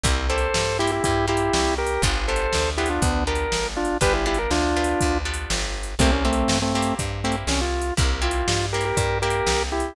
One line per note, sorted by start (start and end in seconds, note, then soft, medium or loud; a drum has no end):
0.04 0.48 C2 medium
0.04 0.27 A#3 loud
0.04 0.27 C4 medium
0.04 0.27 E4 medium
0.04 0.27 G4 loud
0.04 kick medium
0.04 closed hi-hat medium
0.29 0.75 A#3 medium
0.29 0.75 C4 medium
0.29 0.75 E4 medium
0.29 0.75 G4 medium
0.29 0.78 A4 medium
0.29 0.78 C5 medium
0.38 closed hi-hat medium
0.54 1.00 G2 medium
0.54 snare medium
0.79 1.26 A#3 medium
0.79 1.26 C4 medium
0.79 0.91 E4 medium
0.79 1.26 E4 medium
0.79 0.91 G4 medium
0.79 1.26 G4 medium
0.87 closed hi-hat medium
0.92 1.03 E4 medium
0.92 1.03 G4 medium
1.04 1.50 G2 medium
1.04 1.26 E4 medium
1.04 1.26 G4 medium
1.04 kick medium
1.04 closed hi-hat medium
1.28 1.96 A#3 medium
1.28 1.96 C4 medium
1.28 1.96 E4 medium
1.28 1.74 E4 medium
1.28 1.96 G4 medium
1.28 1.74 G4 medium
1.37 closed hi-hat medium
1.53 1.98 C2 medium
1.53 snare medium
1.78 2.02 G4 medium
1.78 2.02 A#4 medium
1.87 closed hi-hat medium
2.02 2.47 G1 medium
2.02 2.27 B3 loud
2.02 2.27 D4 loud
2.02 2.27 F4 loud
2.02 2.27 G4 loud
2.02 kick medium
2.02 closed hi-hat medium
2.28 2.74 B3 medium
2.28 2.74 D4 medium
2.28 2.74 F4 medium
2.28 2.74 G4 medium
2.28 2.70 A4 medium
2.28 2.70 C5 medium
2.36 closed hi-hat medium
2.53 2.99 D2 medium
2.53 snare medium
2.77 3.24 B3 medium
2.77 3.24 D4 medium
2.77 2.89 E4 medium
2.77 3.24 F4 medium
2.77 2.89 G4 medium
2.77 3.24 G4 medium
2.86 closed hi-hat medium
2.90 3.02 D4 medium
2.90 3.02 F4 medium
3.02 3.47 D2 medium
3.02 3.24 B3 medium
3.02 3.24 D4 medium
3.02 kick medium
3.02 closed hi-hat medium
3.27 3.95 B3 medium
3.27 3.95 D4 medium
3.27 3.95 F4 medium
3.27 3.95 G4 medium
3.27 3.67 A#4 medium
3.35 closed hi-hat medium
3.52 3.97 G1 medium
3.52 snare medium
3.77 3.97 D4 medium
3.77 3.97 F4 medium
3.85 closed hi-hat medium
4.01 4.47 G1 medium
4.01 4.24 B3 loud
4.01 4.24 D4 loud
4.01 4.24 F4 medium
4.01 4.24 G4 medium
4.01 4.13 G4 medium
4.01 4.14 B4 medium
4.01 kick medium
4.01 closed hi-hat medium
4.14 4.25 E4 medium
4.14 4.25 G4 medium
4.26 4.71 B3 medium
4.26 4.71 D4 medium
4.26 4.38 E4 medium
4.26 4.71 F4 medium
4.26 4.71 G4 medium
4.26 4.38 G4 medium
4.35 closed hi-hat medium
4.39 4.51 A#4 medium
4.51 4.95 D2 medium
4.51 5.18 D4 medium
4.51 5.18 F4 medium
4.51 snare medium
4.76 5.22 B3 medium
4.76 5.22 D4 medium
4.76 5.22 F4 medium
4.76 5.22 G4 medium
4.84 closed hi-hat medium
5.01 5.47 D2 medium
5.01 kick medium
5.01 closed hi-hat medium
5.25 5.94 B3 medium
5.25 5.94 D4 medium
5.25 5.94 F4 medium
5.25 5.94 G4 medium
5.34 closed hi-hat medium
5.50 5.95 G1 medium
5.50 snare medium
5.83 closed hi-hat medium
5.99 6.44 C2 medium
5.99 6.11 A3 medium
5.99 6.24 A#3 loud
5.99 6.11 C4 medium
5.99 6.24 C4 medium
5.99 6.24 E4 loud
5.99 6.24 G4 loud
5.99 kick medium
5.99 closed hi-hat medium
6.12 6.24 C#4 medium
6.25 6.58 A3 medium
6.25 6.70 A#3 medium
6.25 6.58 C4 medium
6.25 6.70 C4 medium
6.25 6.70 E4 medium
6.25 6.70 G4 medium
6.33 closed hi-hat medium
6.48 6.93 G2 medium
6.48 snare loud
6.62 6.74 A3 medium
6.62 6.74 C4 medium
6.74 6.94 A3 medium
6.74 7.21 A#3 medium
6.74 6.94 C4 medium
6.74 7.21 C4 medium
6.74 7.21 E4 medium
6.74 7.21 G4 medium
6.82 closed hi-hat medium
6.99 7.44 G2 medium
6.99 kick medium
6.99 closed hi-hat medium
7.24 7.36 A3 medium
7.24 7.93 A#3 medium
7.24 7.36 C4 medium
7.24 7.93 C4 medium
7.24 7.93 E4 medium
7.24 7.93 G4 medium
7.32 closed hi-hat medium
7.47 7.92 C2 medium
7.47 7.61 C#4 medium
7.47 snare medium
7.61 7.94 F4 medium
7.82 closed hi-hat medium
7.97 8.43 C2 medium
7.97 8.20 A#3 loud
7.97 8.20 C4 medium
7.97 8.20 E4 medium
7.97 8.20 G4 medium
7.97 kick loud
7.97 closed hi-hat medium
8.22 8.67 A#3 medium
8.22 8.67 C4 medium
8.22 8.67 E4 medium
8.22 8.66 F4 medium
8.22 8.67 G4 medium
8.31 closed hi-hat medium
8.48 8.92 G2 medium
8.48 snare loud
8.73 9.20 A#3 medium
8.73 9.20 C4 medium
8.73 9.20 E4 medium
8.73 8.85 G4 medium
8.73 9.20 G4 medium
8.73 8.85 A#4 medium
8.81 closed hi-hat medium
8.85 8.97 G4 medium
8.85 8.97 A#4 medium
8.97 9.42 G2 medium
8.97 9.18 G4 medium
8.97 9.18 A#4 medium
8.97 kick medium
8.97 closed hi-hat medium
9.22 9.91 A#3 medium
9.22 9.91 C4 medium
9.22 9.91 E4 medium
9.22 9.63 G4 medium
9.22 9.91 G4 medium
9.22 9.63 A#4 medium
9.30 closed hi-hat medium
9.46 9.91 C2 medium
9.46 snare medium
9.72 9.94 E4 medium
9.72 9.94 G4 medium
9.80 closed hi-hat medium